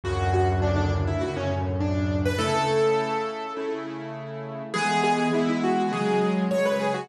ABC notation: X:1
M:4/4
L:1/16
Q:1/4=102
K:A
V:1 name="Acoustic Grand Piano"
F2 F z D D z E F C z2 D3 B | A8 z8 | G2 G2 E E F2 G3 z c B G F |]
V:2 name="Acoustic Grand Piano"
[D,,F,,A,,C,]8 [D,,F,,A,,C,]8 | [C,A,E]8 [C,A,E]8 | [E,G,B,]4 [E,G,B,]4 [C,F,G,]4 [C,F,G,]4 |]